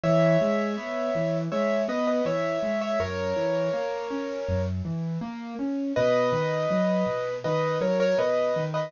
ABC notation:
X:1
M:4/4
L:1/16
Q:1/4=81
K:B
V:1 name="Acoustic Grand Piano"
[ce]8 [ce]2 [Bd] [Bd] [ce]3 [ce] | [Ac]10 z6 | [Bd]8 [Bd]2 [Ac] [Ac] [Bd]3 [Bd] |]
V:2 name="Acoustic Grand Piano"
E,2 G,2 B,2 E,2 G,2 B,2 E,2 G,2 | F,,2 E,2 A,2 C2 F,,2 E,2 A,2 C2 | B,,2 D,2 F,2 B,,2 D,2 F,2 B,,2 D,2 |]